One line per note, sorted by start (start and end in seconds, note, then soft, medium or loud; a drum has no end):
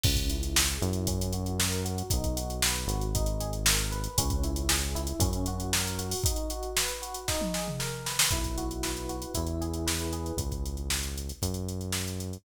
0.03 0.78 C#2 loud
0.03 0.30 C#4 loud
0.03 kick loud
0.03 crash loud
0.16 kick medium
0.16 closed hi-hat medium
0.30 0.56 E4 medium
0.30 closed hi-hat medium
0.43 closed hi-hat medium
0.56 0.82 G#4 medium
0.56 snare loud
0.68 closed hi-hat medium
0.81 2.03 F#2 loud
0.81 1.06 E4 medium
0.81 closed hi-hat medium
0.93 closed hi-hat medium
1.07 1.34 C#4 loud
1.07 kick medium
1.07 closed hi-hat loud
1.21 closed hi-hat medium
1.33 1.59 F#4 medium
1.33 closed hi-hat medium
1.46 closed hi-hat medium
1.59 1.85 A#4 medium
1.59 snare loud
1.72 closed hi-hat medium
1.85 2.10 F#4 medium
1.85 closed hi-hat medium
1.98 closed hi-hat medium
2.10 2.86 B1 loud
2.10 2.37 D#4 loud
2.10 kick loud
2.10 closed hi-hat loud
2.24 kick medium
2.24 closed hi-hat medium
2.36 2.62 F#4 medium
2.36 closed hi-hat medium
2.50 closed hi-hat medium
2.62 2.89 B4 medium
2.62 snare loud
2.75 closed hi-hat medium
2.87 4.08 G#1 loud
2.87 3.13 F#4 medium
2.87 closed hi-hat medium
3.01 closed hi-hat medium
3.15 3.41 D#4 loud
3.15 kick medium
3.15 closed hi-hat medium
3.26 closed hi-hat medium
3.40 3.66 G#4 medium
3.40 closed hi-hat medium
3.53 closed hi-hat medium
3.66 3.91 A#4 medium
3.66 snare loud
3.79 closed hi-hat medium
3.92 4.16 B4 medium
3.92 closed hi-hat medium
4.04 closed hi-hat medium
4.18 5.13 C#2 loud
4.18 4.44 C#4 loud
4.18 kick medium
4.18 closed hi-hat loud
4.30 kick medium
4.30 closed hi-hat medium
4.43 4.70 E4 medium
4.43 closed hi-hat medium
4.56 closed hi-hat medium
4.69 4.96 G#4 medium
4.69 snare loud
4.82 closed hi-hat medium
4.95 5.20 E4 loud
4.95 closed hi-hat medium
5.07 closed hi-hat medium
5.20 6.15 F#2 loud
5.20 5.47 C#4 loud
5.20 kick loud
5.20 closed hi-hat loud
5.33 closed hi-hat medium
5.46 5.73 F#4 medium
5.46 closed hi-hat medium
5.60 closed hi-hat medium
5.73 5.99 A#4 medium
5.73 snare loud
5.87 closed hi-hat medium
5.99 6.23 F#4 medium
5.99 closed hi-hat medium
6.11 open hi-hat medium
6.24 6.51 D#4 loud
6.24 kick loud
6.24 closed hi-hat loud
6.36 closed hi-hat medium
6.50 6.77 F#4 medium
6.50 closed hi-hat medium
6.63 closed hi-hat medium
6.77 7.03 B4 medium
6.77 snare loud
6.88 closed hi-hat medium
7.02 7.26 F#4 medium
7.02 closed hi-hat medium
7.14 closed hi-hat medium
7.28 7.54 D#4 loud
7.28 kick medium
7.28 snare medium
7.41 high tom medium
7.54 7.80 G#4 medium
7.54 snare medium
7.68 mid tom medium
7.79 8.05 A#4 medium
7.79 snare medium
8.06 8.30 B4 medium
8.06 snare medium
8.19 snare loud
8.30 9.26 B1 medium
8.30 9.30 E4 medium
8.30 kick medium
8.30 closed hi-hat medium
8.44 kick medium
8.44 closed hi-hat medium
8.58 9.09 F#4 medium
8.58 closed hi-hat medium
8.71 closed hi-hat medium
8.83 9.32 B4 medium
8.83 snare medium
8.97 closed hi-hat medium
9.09 9.34 F#4 medium
9.09 closed hi-hat medium
9.22 closed hi-hat medium
9.34 10.32 E2 loud
9.34 10.33 E4 loud
9.34 kick medium
9.34 closed hi-hat medium
9.47 closed hi-hat medium
9.61 10.12 G#4 medium
9.61 closed hi-hat medium
9.73 closed hi-hat medium
9.87 10.36 B4 medium
9.87 snare medium
9.99 closed hi-hat medium
10.13 10.37 G#4 medium
10.13 closed hi-hat medium
10.26 closed hi-hat medium
10.37 11.32 C#2 loud
10.37 kick medium
10.37 closed hi-hat medium
10.52 kick medium
10.52 closed hi-hat medium
10.66 closed hi-hat medium
10.77 closed hi-hat soft
10.90 snare medium
11.03 closed hi-hat medium
11.17 closed hi-hat medium
11.29 closed hi-hat medium
11.42 12.38 F#2 loud
11.42 kick medium
11.42 closed hi-hat medium
11.54 closed hi-hat medium
11.69 closed hi-hat medium
11.81 closed hi-hat medium
11.92 snare medium
12.07 closed hi-hat medium
12.20 closed hi-hat medium
12.33 closed hi-hat medium